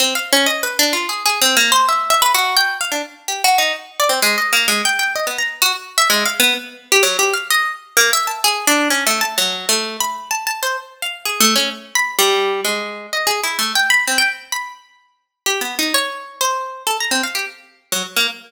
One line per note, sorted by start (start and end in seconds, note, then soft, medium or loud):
0.00 0.14 C4 medium
0.15 0.29 F5 medium
0.33 0.47 C#4 medium
0.46 0.60 D#5 medium
0.63 0.77 B4 medium
0.79 0.93 D4 medium
0.93 1.07 F4 medium
1.09 1.23 G#4 medium
1.26 1.40 G#4 medium
1.42 1.56 C4 loud
1.57 1.71 A#3 medium
1.72 1.86 C5 loud
1.89 2.10 E5 medium
2.10 2.21 E5 medium
2.22 2.33 B4 loud
2.34 2.56 F#4 loud
2.57 2.78 G5 loud
2.81 2.91 F5 medium
2.92 3.02 D4 medium
3.28 3.42 G4 medium
3.44 3.58 F#4 loud
3.58 3.72 D#4 medium
4.00 4.10 D5 medium
4.09 4.20 C4 medium
4.22 4.36 G#3 medium
4.38 4.52 D#5 medium
4.53 4.67 A#3 medium
4.68 4.82 G#3 medium
4.85 4.99 G5 loud
4.99 5.13 G5 medium
5.16 5.26 D#5 medium
5.27 5.37 B3 soft
5.38 5.59 A#5 medium
5.62 5.72 F#4 loud
5.98 6.08 E5 loud
6.10 6.24 G#3 medium
6.25 6.40 F5 medium
6.40 6.54 B3 loud
6.92 7.02 G4 medium
7.03 7.17 F#3 medium
7.19 7.33 G4 medium
7.33 7.48 F5 medium
7.50 7.71 D#5 medium
7.97 8.11 A#3 medium
8.13 8.27 E5 loud
8.27 8.41 A5 medium
8.44 8.65 G#4 medium
8.67 8.88 D4 loud
8.90 9.04 C#4 medium
9.07 9.21 A3 medium
9.21 9.35 A5 medium
9.38 9.66 F#3 medium
9.69 9.97 A3 medium
10.00 10.29 B5 medium
10.31 10.45 A5 medium
10.47 10.61 A5 medium
10.63 10.77 C5 medium
11.02 11.23 F5 medium
11.25 11.39 G#4 medium
11.40 11.54 A3 loud
11.56 11.70 C#4 medium
11.95 12.16 B5 medium
12.19 12.61 G3 loud
12.65 13.07 G#3 medium
13.13 13.27 D#5 medium
13.27 13.41 G#4 medium
13.43 13.58 E4 medium
13.59 13.73 A3 medium
13.75 13.89 G5 medium
13.90 14.04 B5 loud
14.07 14.18 C4 medium
14.18 14.29 G5 medium
14.52 14.73 B5 medium
15.46 15.60 G4 medium
15.61 15.75 B3 medium
15.79 15.93 D#4 medium
15.94 16.36 C#5 medium
16.41 16.83 C5 medium
16.87 16.97 A4 medium
17.00 17.11 A#5 medium
17.11 17.22 C4 medium
17.23 17.34 F5 medium
17.35 17.45 G4 medium
17.92 18.03 F#3 medium
18.16 18.27 A#3 medium